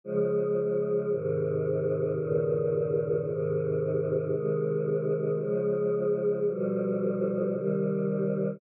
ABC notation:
X:1
M:4/4
L:1/8
Q:1/4=56
K:Ab
V:1 name="Choir Aahs" clef=bass
[D,F,A,]2 [A,,C,E,]2 [G,,B,,D,E,]2 [A,,C,E,]2 | [C,E,A,]2 [D,F,A,]2 [=B,,=D,F,G,]2 [C,E,G,]2 |]